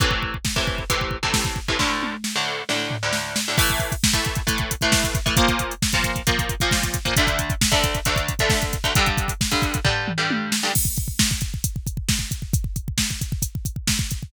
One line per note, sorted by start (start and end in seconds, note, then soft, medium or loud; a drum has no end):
0.00 0.36 A2 medium
0.00 0.36 C3 medium
0.00 0.36 E3 medium
0.00 kick loud
0.00 closed hi-hat medium
0.11 kick medium
0.23 kick medium
0.34 kick medium
0.45 kick medium
0.45 snare loud
0.56 0.83 A2 medium
0.56 0.83 C3 medium
0.56 0.83 E3 medium
0.56 kick medium
0.67 kick medium
0.78 kick medium
0.90 1.17 A2 medium
0.90 1.17 C3 medium
0.90 1.17 E3 medium
0.90 kick medium
0.90 closed hi-hat loud
1.01 kick medium
1.11 kick medium
1.23 1.59 A2 medium
1.23 1.59 C3 medium
1.23 1.59 E3 medium
1.23 kick medium
1.34 kick medium
1.34 snare loud
1.45 kick medium
1.56 kick medium
1.68 1.77 A2 medium
1.68 1.77 C3 medium
1.68 1.77 E3 medium
1.68 kick medium
1.79 2.15 D2 medium
1.79 2.15 A2 medium
1.79 2.15 D3 medium
1.79 kick medium
1.79 snare medium
2.03 high tom medium
2.24 snare medium
2.36 2.62 D2 medium
2.36 2.62 A2 medium
2.36 2.62 D3 medium
2.69 2.96 D2 medium
2.69 2.96 A2 medium
2.69 2.96 D3 medium
2.69 snare medium
2.91 floor tom medium
3.03 3.39 D2 medium
3.03 3.39 A2 medium
3.03 3.39 D3 medium
3.13 snare medium
3.36 snare loud
3.48 3.57 D2 medium
3.48 3.57 A2 medium
3.48 3.57 D3 medium
3.58 3.94 A2 medium
3.58 3.94 E3 loud
3.58 3.94 A3 medium
3.58 kick loud
3.58 crash loud
3.69 kick medium
3.69 closed hi-hat medium
3.79 kick medium
3.79 closed hi-hat medium
3.92 kick medium
3.92 closed hi-hat medium
4.04 kick loud
4.04 snare loud
4.13 4.40 A2 medium
4.13 4.40 E3 medium
4.13 4.40 A3 medium
4.13 kick medium
4.13 closed hi-hat medium
4.25 kick medium
4.25 closed hi-hat medium
4.35 kick medium
4.35 closed hi-hat medium
4.47 4.74 A2 medium
4.47 4.74 E3 medium
4.47 4.74 A3 medium
4.47 kick medium
4.47 closed hi-hat loud
4.58 kick medium
4.58 closed hi-hat medium
4.71 kick medium
4.71 closed hi-hat loud
4.81 5.18 A2 medium
4.81 5.18 E3 medium
4.81 5.18 A3 medium
4.81 kick medium
4.81 closed hi-hat medium
4.92 kick loud
4.92 snare loud
5.04 kick medium
5.04 closed hi-hat medium
5.15 kick loud
5.15 closed hi-hat medium
5.26 5.35 A2 medium
5.26 5.35 E3 medium
5.26 5.35 A3 medium
5.26 kick medium
5.26 closed hi-hat medium
5.37 5.73 A#2 loud
5.37 5.73 F3 medium
5.37 5.73 A#3 medium
5.37 kick loud
5.37 closed hi-hat loud
5.48 kick medium
5.48 closed hi-hat medium
5.59 kick medium
5.59 closed hi-hat medium
5.71 closed hi-hat medium
5.82 kick medium
5.82 snare loud
5.92 6.21 A#2 medium
5.92 6.21 F3 medium
5.92 6.21 A#3 medium
5.92 kick medium
5.92 closed hi-hat medium
6.04 kick medium
6.04 closed hi-hat medium
6.16 kick medium
6.16 closed hi-hat medium
6.27 6.54 A#2 medium
6.27 6.54 F3 medium
6.27 6.54 A#3 medium
6.27 kick loud
6.27 closed hi-hat loud
6.39 kick medium
6.39 closed hi-hat medium
6.49 kick medium
6.49 closed hi-hat medium
6.60 6.97 A#2 medium
6.60 6.97 F3 medium
6.60 6.97 A#3 medium
6.60 kick medium
6.60 closed hi-hat medium
6.71 kick loud
6.71 snare loud
6.83 kick medium
6.83 closed hi-hat medium
6.94 kick medium
6.94 closed hi-hat loud
7.05 7.14 A#2 medium
7.05 7.14 F3 medium
7.05 7.14 A#3 medium
7.05 kick medium
7.05 closed hi-hat medium
7.16 7.53 D2 medium
7.16 7.53 D3 medium
7.16 7.53 A3 medium
7.16 kick loud
7.16 closed hi-hat loud
7.27 kick medium
7.27 closed hi-hat medium
7.39 kick medium
7.39 closed hi-hat loud
7.50 kick loud
7.50 closed hi-hat medium
7.61 kick medium
7.61 snare loud
7.71 7.99 D2 medium
7.71 7.99 D3 medium
7.71 7.99 A3 medium
7.71 kick loud
7.71 closed hi-hat medium
7.84 kick loud
7.84 closed hi-hat medium
7.94 kick medium
7.94 closed hi-hat medium
8.05 8.33 D2 medium
8.05 8.33 D3 medium
8.05 8.33 A3 medium
8.05 kick medium
8.05 closed hi-hat loud
8.16 kick medium
8.16 closed hi-hat medium
8.28 kick medium
8.28 closed hi-hat medium
8.39 8.76 D2 medium
8.39 8.76 D3 medium
8.39 8.76 A3 medium
8.39 kick medium
8.39 closed hi-hat medium
8.50 kick loud
8.50 snare loud
8.62 kick medium
8.62 closed hi-hat medium
8.73 kick medium
8.73 closed hi-hat medium
8.84 8.93 D2 medium
8.84 8.93 D3 medium
8.84 8.93 A3 medium
8.84 kick medium
8.84 closed hi-hat medium
8.95 9.32 G2 medium
8.95 9.32 D3 medium
8.95 9.32 G3 medium
8.95 kick loud
8.95 closed hi-hat loud
9.06 kick medium
9.06 closed hi-hat medium
9.17 kick loud
9.17 closed hi-hat medium
9.28 kick medium
9.28 closed hi-hat medium
9.41 kick medium
9.41 snare loud
9.51 9.78 G2 medium
9.51 9.78 D3 medium
9.51 9.78 G3 medium
9.51 kick medium
9.51 closed hi-hat medium
9.62 kick loud
9.62 closed hi-hat medium
9.74 kick medium
9.74 closed hi-hat medium
9.85 10.11 G2 medium
9.85 10.11 D3 medium
9.85 10.11 G3 medium
9.85 kick loud
9.85 floor tom medium
10.08 mid tom medium
10.18 10.54 G2 medium
10.18 10.54 D3 medium
10.18 10.54 G3 medium
10.31 high tom loud
10.52 snare loud
10.63 10.72 G2 medium
10.63 10.72 D3 medium
10.63 10.72 G3 medium
10.75 kick loud
10.75 crash loud
10.85 kick medium
10.97 kick loud
10.97 closed hi-hat medium
11.08 kick medium
11.19 kick loud
11.19 snare loud
11.31 kick medium
11.41 kick medium
11.41 closed hi-hat medium
11.54 kick medium
11.64 kick medium
11.64 closed hi-hat loud
11.76 kick medium
11.87 kick medium
11.87 closed hi-hat medium
11.97 kick medium
12.09 kick loud
12.09 snare loud
12.19 kick medium
12.31 kick medium
12.31 closed hi-hat medium
12.42 kick medium
12.53 kick loud
12.53 closed hi-hat loud
12.64 kick medium
12.76 kick medium
12.76 closed hi-hat medium
12.88 kick medium
12.98 kick medium
12.98 snare loud
13.11 kick medium
13.21 kick medium
13.21 closed hi-hat medium
13.32 kick medium
13.42 kick medium
13.42 closed hi-hat loud
13.55 kick medium
13.65 kick medium
13.65 closed hi-hat medium
13.76 kick medium
13.87 kick medium
13.87 snare loud
13.99 kick loud
14.11 kick medium
14.11 closed hi-hat medium
14.23 kick medium